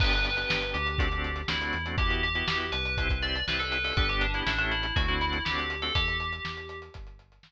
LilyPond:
<<
  \new Staff \with { instrumentName = "Tubular Bells" } { \time 4/4 \key g \major \tempo 4 = 121 b'4. g'4. e'4 | g'8 g'4 b'4 d''8 b'16 a'16 b'16 a'16 | b'16 g'16 d'16 e'16 d'16 d'16 e'8 fis'16 e'16 e'8 g'8. a'16 | g'2 r2 | }
  \new Staff \with { instrumentName = "Drawbar Organ" } { \time 4/4 \key g \major <b d' g'>8. <b d' g'>4~ <b d' g'>16 <a c' d' fis'>16 <a c' d' fis'>8. <a c' d' fis'>8. <a c' d' fis'>16 | <b e' fis' g'>8. <b e' fis' g'>4~ <b e' fis' g'>16 <c' e' g'>16 <c' e' g'>8. <c' e' g'>8. <c' e' g'>16 | <b d' g'>8. <b d' g'>16 <a cis' e' g'>4 <a c' d' fis'>16 <a c' d' fis'>8. <a c' d' fis'>8. <a c' d' fis'>16 | r1 | }
  \new Staff \with { instrumentName = "Synth Bass 1" } { \clef bass \time 4/4 \key g \major g,,4 g,,8 d,4. d,8 e,8~ | e,4 e,8 c,4. c,4 | g,,4 a,,4 d,4 d,4 | e,4 e,4 g,,4 g,,4 | }
  \new DrumStaff \with { instrumentName = "Drums" } \drummode { \time 4/4 <cymc bd>16 hh16 hh16 hh16 sn16 hh16 hh16 hh16 <hh bd>16 hh16 hh16 hh16 sn16 hh16 hh16 hh16 | <hh bd>16 hh16 hh16 hh16 sn16 hh16 hh16 hh16 <hh bd>16 <hh bd>16 hh16 hh16 sn16 hh16 hh16 hho16 | <hh bd>16 hh16 hh16 hh16 sn16 hh16 hh16 hh16 <hh bd>16 hh16 hh16 hh16 sn16 hh16 hh16 hh16 | <hh bd>16 hh16 hh16 hh16 sn16 hh16 hh16 hh16 <hh bd>16 hh16 hh16 hh16 sn4 | }
>>